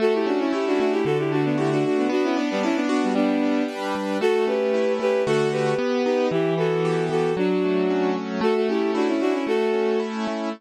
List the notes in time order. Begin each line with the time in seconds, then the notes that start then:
0.00 A3 F#4 A4
0.14 E4 G4
0.26 C#4 D4 F#4
0.39 C#4 E4
0.53 E4 G4
0.67 D4 F#4
0.80 A3 D4 F#4
0.92 E4 G4
1.05 D3 F#4 A4
1.19 E4 G4
1.32 A3 D4 F#4
1.45 B3 D4
1.58 E4 F#4 G4
1.71 D4 F#4
1.84 D3 D4 F#4
1.97 B3 D4
2.09 B3 D4 F#4
2.23 C#4 E4
2.36 B3 D4
2.51 G3 B3
2.63 C#4 D4 E4
2.75 B3 D4
2.89 B3 D4 F#4
3.03 G3 B3
3.15 G3 B3 D4
3.43 D4
3.68 B4
3.95 G3
4.21 A3 F#4 A4
4.47 C#4 G4 B4
4.74 E4
5.00 A3 G4 B4
5.26 D3 A3 F#4 A4
5.52 G4 B4
5.79 B3
6.05 D#4 G4 B4
6.31 E3 E4 G4
6.58 B3 F#4 A4
6.85 G4
7.10 E3 F#4 A4
7.37 F#3 D4 F#4
7.64 A3
7.90 C#4
8.16 F#3
8.41 A3 F#4 A4
8.56 F#4 A4
8.69 C#4 E4 G4
8.95 D4 E4 F#4
9.08 C#4 E4
9.21 A3 D4 F#4
9.33 C#4 E4
9.47 A3 F#4 A4
9.74 C#4
10.00 E4
10.27 A3